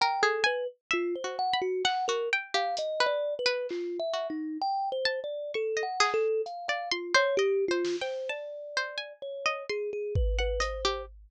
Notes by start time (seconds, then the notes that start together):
0.01 A#4 G5
0.23 G#4 A4
0.44 B4 G#5
0.91 F4 E5
1.16 C5
1.24 F#4
1.39 F#5
1.53 B5
1.62 F#4
1.85 F#5, clap
2.08 F#4 A#4
2.33 G5
2.54 G4 F5
2.77 D#5, closed hi-hat
3.00 B4
3.06 D5
3.39 B4
3.46 B4
3.69 F4, clap
4.00 E5
4.13 F#4
4.30 D#4
4.62 G5
4.92 C5
5.05 A5
5.24 D5
5.54 A4 C#6
5.77 D#5
5.83 F#5
6.00 G#4, clap
6.14 A4
6.46 F5, closed hi-hat
6.68 D5 F5
6.92 F4 C6
7.14 C5 C#5
7.37 G4 D#5
7.68 F4 C5
7.85 snare
8.01 C5 G5
8.29 D5 A5
8.77 C5
8.98 G#5
9.22 C#5
9.46 D#5
9.69 G#4 C6
9.93 G#4
10.15 B4, kick
10.39 B4 F#5
10.60 C5 D#5, closed hi-hat
10.85 G4